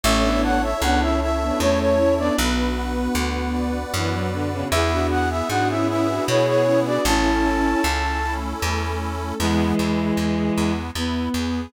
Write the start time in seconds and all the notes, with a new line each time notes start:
0.04 A1 A3 C#4 E4 A4 C#5 E5
0.24 B3 D4
0.43 F#5 A5
0.63 E5
0.81 C#2 B3 D4 C#5 F#5
1.01 C#4 E4 E5
1.21 C#4 E4 E5
1.42 B3 D4
1.60 E2 A3 C#4 C#5
1.80 C#5
1.98 C#4 E4 A5
2.18 B3 D4 D5
2.38 B1 B3 D4 F#4 B4
2.77 F#5
3.15 D2 B4
3.54 D5
3.94 F#2 E3 B4
4.13 F#3
4.31 D3 F#5
4.52 C#3
4.72 E2 B3 E4 G#4 E5
4.93 D4 F#4
5.11 G#4 F#5
5.31 E5
5.49 G#2 B3 D4 F#4 F#5
5.69 C#4 E4 E5
5.88 B3 C#4 E4 G#4 B4 E5
6.08 D4 F#4
6.27 B2 B3 E4 G#4 C#5
6.47 C#5
6.65 C#4 E4 G#4
6.86 D4 F#4 D5
7.05 A1 C#4 E4 A4 A5
7.44 A4
7.84 C#2 C#4
8.23 A3 C#4 E4 A4
8.61 E2 C#4
9.01 A4
9.40 E2 E3 G#3 B3
9.79 E2 E4
10.17 E2 G#4
10.56 E2 B3
10.94 E2 B3 E4
11.34 E2 G#4